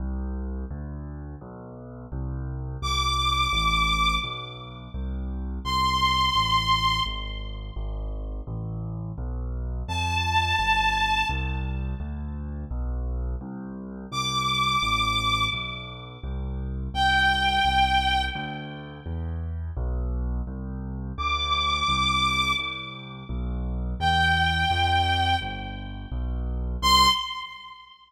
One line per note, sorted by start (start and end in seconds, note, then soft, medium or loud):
0.00 0.65 C2 medium
0.71 1.35 D2 medium
1.41 2.06 B1 medium
2.12 2.77 C2 medium
2.82 3.47 C2 medium
2.82 4.15 D6 medium
3.53 4.18 A1 medium
4.24 4.89 B1 medium
4.94 5.59 C2 medium
5.65 6.30 C2 medium
5.65 7.00 C6 medium
6.35 7.00 A1 medium
7.06 7.71 G#1 medium
7.76 8.41 G#1 medium
8.47 9.12 A1 medium
9.18 9.83 B1 medium
9.88 10.53 F2 medium
9.88 11.26 A5 medium
10.59 11.24 G1 medium
11.29 11.94 C2 medium
12.00 12.65 D2 medium
12.71 13.36 B1 medium
13.41 14.06 C2 medium
14.12 14.77 C2 medium
14.12 15.44 D6 medium
14.82 15.47 A1 medium
15.53 16.18 B1 medium
16.24 16.89 C2 medium
16.94 17.59 C2 medium
16.94 18.22 G5 medium
17.65 18.30 C2 medium
18.35 19.00 D2 medium
19.06 19.71 E2 medium
19.77 20.41 B1 loud
20.47 21.12 C2 medium
21.18 21.83 D2 medium
21.18 22.52 D6 medium
21.88 22.53 C2 medium
22.59 23.24 C2 medium
23.29 23.94 B1 medium
24.00 24.65 E2 medium
24.00 25.36 G5 medium
24.70 25.35 F2 medium
25.41 26.06 G1 medium
26.12 26.76 B1 medium
26.82 27.07 C2 loud
26.82 27.07 C6 loud